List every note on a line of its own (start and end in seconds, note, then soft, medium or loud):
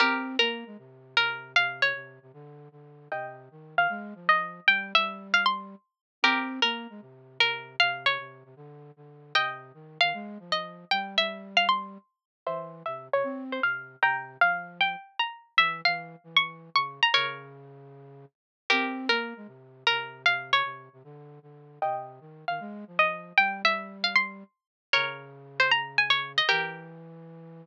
0.00 0.37 C4 loud
0.00 0.36 G4 medium
0.00 0.36 A#4 medium
0.39 0.64 A#3 medium
0.39 1.08 A#4 medium
0.66 0.77 G#3 medium
0.78 1.15 C3 medium
1.17 1.54 C3 medium
1.17 1.52 A#4 medium
1.56 1.93 C3 loud
1.56 1.81 F5 medium
1.82 2.28 C#5 medium
1.95 2.19 C3 medium
2.22 2.32 C3 medium
2.33 2.69 D3 loud
2.72 3.08 D3 medium
3.12 3.49 C3 medium
3.12 3.73 D#5 medium
3.12 3.73 G5 medium
3.51 3.75 D#3 medium
3.76 3.87 D#3 medium
3.76 4.27 F5 medium
3.89 4.14 G#3 loud
4.15 4.60 F3 medium
4.29 4.66 D#5 medium
4.67 4.93 G3 medium
4.67 4.92 G5 medium
4.95 5.75 G3 medium
4.95 5.27 E5 medium
5.34 5.45 F5 medium
5.46 6.02 C6 medium
6.23 6.60 C4 loud
6.23 6.60 G4 medium
6.23 6.60 A#4 medium
6.62 6.87 A#3 medium
6.62 7.31 A#4 medium
6.90 7.01 G#3 medium
7.01 7.38 C3 medium
7.38 7.76 C3 medium
7.38 7.76 A#4 medium
7.80 8.18 C3 loud
7.80 8.05 F5 medium
8.06 8.52 C#5 medium
8.19 8.43 C3 medium
8.45 8.55 C3 medium
8.56 8.91 D3 loud
8.97 9.33 D3 medium
9.35 9.72 C3 medium
9.35 9.97 D#5 medium
9.35 9.97 G5 medium
9.74 9.98 D#3 medium
10.01 10.13 D#3 medium
10.01 10.50 F5 medium
10.14 10.38 G#3 loud
10.39 10.85 F3 medium
10.52 10.90 D#5 medium
10.91 11.17 G3 medium
10.91 11.15 G5 medium
11.17 11.98 G3 medium
11.17 11.50 E5 medium
11.57 11.68 F5 medium
11.69 12.25 C6 medium
12.46 12.83 E3 medium
12.46 12.83 C5 medium
12.46 12.83 E5 medium
12.86 13.09 C3 medium
12.86 13.07 E5 medium
13.13 13.24 C3 medium
13.13 13.44 C#5 medium
13.24 13.60 C4 medium
13.52 13.62 C5 medium
13.62 13.96 C3 medium
13.62 13.99 F5 medium
14.02 14.37 C3 medium
14.02 14.39 G5 medium
14.02 14.39 A#5 medium
14.41 14.96 F3 medium
14.41 14.78 F5 medium
14.81 15.18 G5 medium
15.19 15.55 A#5 medium
15.57 15.82 E3 medium
15.57 15.81 E5 medium
15.85 16.16 E3 medium
15.85 16.29 F5 medium
16.24 16.70 E3 medium
16.37 16.74 C#6 medium
16.75 17.00 C#3 medium
16.75 17.01 C#6 medium
17.03 17.14 A#5 medium
17.14 18.25 C#3 loud
17.14 18.25 A#4 medium
17.14 18.25 C#5 medium
18.70 19.08 C4 loud
18.70 19.06 G4 medium
18.70 19.06 A#4 medium
19.09 19.34 A#3 medium
19.09 19.78 A#4 medium
19.36 19.47 G#3 medium
19.47 19.84 C3 medium
19.87 20.25 C3 medium
19.87 20.22 A#4 medium
20.25 20.62 C3 loud
20.25 20.51 F5 medium
20.53 20.99 C#5 medium
20.64 20.89 C3 medium
20.93 21.03 C3 medium
21.04 21.39 D3 loud
21.42 21.79 D3 medium
21.82 22.20 C3 medium
21.82 22.43 D#5 medium
21.82 22.43 G5 medium
22.21 22.45 D#3 medium
22.48 22.60 D#3 medium
22.48 22.97 F5 medium
22.60 22.84 G#3 loud
22.87 23.33 F3 medium
22.99 23.37 D#5 medium
23.37 23.63 G3 medium
23.37 23.62 G5 medium
23.63 24.44 G3 medium
23.63 23.97 E5 medium
24.04 24.15 F5 medium
24.16 24.72 C6 medium
24.93 26.41 C#3 loud
24.93 25.54 A#4 medium
24.93 25.54 C#5 medium
25.60 25.71 C5 medium
25.71 25.97 A#5 medium
25.98 26.09 G#5 medium
26.10 26.32 C#5 medium
26.38 26.49 D#5 medium
26.49 27.65 E3 loud
26.49 27.23 G4 medium
26.49 27.23 A#4 medium